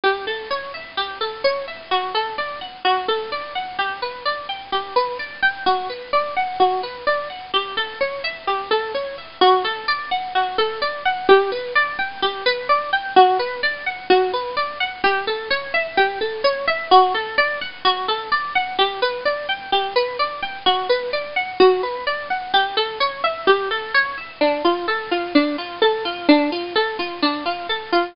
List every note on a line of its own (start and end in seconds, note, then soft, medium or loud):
0.04 0.25 G4 medium
0.27 0.48 A4 medium
0.50 0.72 C#5 medium
0.74 0.96 E5 medium
0.97 1.19 G4 medium
1.21 1.42 A4 medium
1.44 1.66 C#5 medium
1.67 1.89 E5 medium
1.91 2.13 F#4 medium
2.14 2.36 A4 medium
2.38 2.60 D5 medium
2.61 2.83 F#5 medium
2.85 3.06 F#4 medium
3.08 3.30 A4 medium
3.32 3.53 D5 medium
3.55 3.77 F#5 medium
3.79 4.00 G4 medium
4.02 4.24 B4 medium
4.25 4.47 D5 medium
4.49 4.70 G5 medium
4.72 4.94 G4 medium
4.96 5.17 B4 medium
5.19 5.41 D5 medium
5.42 5.64 G5 medium
5.66 5.88 F#4 medium
5.89 6.11 B4 medium
6.13 6.34 D5 medium
6.36 6.58 F#5 medium
6.60 6.81 F#4 medium
6.83 7.05 B4 medium
7.07 7.28 D5 medium
7.30 7.51 F#5 medium
7.54 7.75 G4 medium
7.77 7.98 A4 medium
8.01 8.22 C#5 medium
8.24 8.45 E5 medium
8.47 8.69 G4 medium
8.71 8.92 A4 medium
8.94 9.16 C#5 medium
9.18 9.39 E5 medium
9.41 9.63 F#4 medium
9.64 9.86 A4 medium
9.88 10.09 D5 medium
10.11 10.33 F#5 medium
10.35 10.57 F#4 medium
10.58 10.80 A4 medium
10.82 11.03 D5 medium
11.05 11.27 F#5 medium
11.29 11.50 G4 loud
11.52 11.73 B4 medium
11.75 11.97 D5 medium
11.99 12.20 G5 medium
12.22 12.44 G4 medium
12.46 12.67 B4 medium
12.69 12.91 D5 medium
12.93 13.14 G5 medium
13.16 13.38 F#4 medium
13.39 13.61 B4 medium
13.63 13.84 D5 medium
13.86 14.08 F#5 medium
14.10 14.31 F#4 loud
14.33 14.55 B4 medium
14.57 14.78 D5 medium
14.80 15.02 F#5 medium
15.04 15.25 G4 medium
15.27 15.49 A4 medium
15.50 15.72 C#5 medium
15.74 15.95 E5 medium
15.97 16.19 G4 medium
16.21 16.42 A4 medium
16.44 16.66 C#5 medium
16.67 16.89 E5 medium
16.91 17.13 F#4 medium
17.14 17.36 A4 medium
17.38 17.59 D5 medium
17.61 17.83 F#5 medium
17.85 18.06 F#4 loud
18.08 18.30 A4 medium
18.32 18.53 D5 medium
18.55 18.77 F#5 medium
18.79 19.00 G4 medium
19.02 19.24 B4 medium
19.25 19.47 D5 medium
19.49 19.70 G5 medium
19.72 19.94 G4 medium
19.96 20.17 B4 medium
20.19 20.41 D5 medium
20.42 20.64 G5 medium
20.66 20.88 F#4 loud
20.89 21.11 B4 medium
21.13 21.34 D5 medium
21.36 21.58 F#5 medium
21.60 21.81 F#4 medium
21.83 22.05 B4 medium
22.07 22.28 D5 medium
22.30 22.52 F#5 medium
22.54 22.75 G4 medium
22.77 22.98 A4 medium
23.00 23.22 C#5 medium
23.24 23.45 E5 medium
23.47 23.69 G4 loud
23.71 23.92 A4 medium
23.94 24.16 C#5 medium
24.18 24.39 E5 medium
24.41 24.62 D4 medium
24.64 24.86 F4 medium
24.88 25.09 A4 medium
25.11 25.33 F4 medium
25.35 25.56 D4 medium
25.58 25.80 F4 medium
25.82 26.03 A4 medium
26.05 26.27 F4 medium
26.29 26.50 D4 medium
26.52 26.74 F4 medium
26.75 26.97 A4 medium
26.99 27.20 F4 medium
27.22 27.44 D4 medium
27.46 27.67 F4 medium
27.69 27.91 A4 medium
27.92 28.14 F4 medium